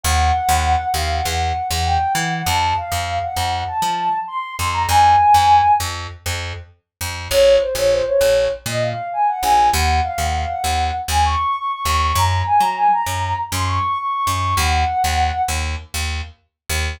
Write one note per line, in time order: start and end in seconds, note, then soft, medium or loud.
0.04 0.32 D#2 loud
0.04 0.86 F#5 loud
0.49 0.76 D#2 loud
0.94 1.21 D#2 medium
0.94 1.09 F5 medium
1.09 1.23 F#5 medium
1.25 1.53 E2 loud
1.25 1.39 F#5 medium
1.41 1.65 F#5 medium
1.70 1.98 E2 loud
1.70 1.84 F#5 medium
1.86 2.13 G5 medium
2.15 2.42 E3 loud
2.15 2.30 F#5 medium
2.31 2.45 F#5 medium
2.46 2.74 F2 loud
2.46 2.73 A5 medium
2.77 3.19 F5 medium
2.92 3.19 F2 medium
3.22 3.60 F#5 medium
3.36 3.64 F2 medium
3.67 4.16 A5 medium
3.82 4.09 F3 medium
4.27 4.53 C6 medium
4.58 4.86 F2 medium
4.58 4.72 C6 medium
4.73 4.87 A#5 medium
4.89 5.16 F2 loud
4.89 5.71 G#5 loud
5.34 5.62 F2 medium
5.80 6.07 F2 medium
6.26 6.53 F2 medium
7.01 7.28 F2 medium
7.30 7.58 A#1 loud
7.30 7.55 C#5 loud
7.61 7.75 C5 medium
7.75 8.02 A#1 medium
7.75 7.91 C#5 medium
7.92 8.06 C5 medium
8.06 8.44 C#5 medium
8.21 8.48 A#1 medium
8.66 8.93 A#2 medium
8.66 8.82 D#5 medium
8.82 9.07 F5 medium
9.13 9.27 G#5 medium
9.28 9.42 F#5 medium
9.43 9.70 A#1 medium
9.43 9.68 G#5 medium
9.73 10.01 D#2 loud
9.73 9.98 F#5 loud
10.04 10.18 F5 medium
10.18 10.45 D#2 medium
10.18 10.33 F#5 medium
10.33 10.48 F5 medium
10.48 10.92 F#5 medium
10.64 10.91 D#2 medium
11.08 11.36 D#2 medium
11.08 11.24 G#5 medium
11.25 11.53 C#6 medium
11.55 11.70 C#6 medium
11.70 11.85 C#6 medium
11.85 12.13 D#2 loud
11.85 12.14 C#6 medium
12.15 12.43 F#2 loud
12.15 12.41 A#5 medium
12.46 12.60 G#5 medium
12.60 12.88 F#3 medium
12.60 12.75 A#5 medium
12.77 12.91 G#5 medium
12.92 13.35 A#5 medium
13.06 13.34 F#2 medium
13.52 13.79 F#2 loud
13.52 13.67 C6 medium
13.67 13.96 C#6 medium
13.98 14.12 C#6 medium
14.13 14.27 C#6 medium
14.27 14.54 F#2 medium
14.27 14.56 C#6 medium
14.57 14.84 D#2 loud
14.57 15.41 F#5 loud
15.04 15.31 D#2 medium
15.48 15.76 D#2 medium
15.94 16.21 D#2 medium
16.69 16.97 D#2 loud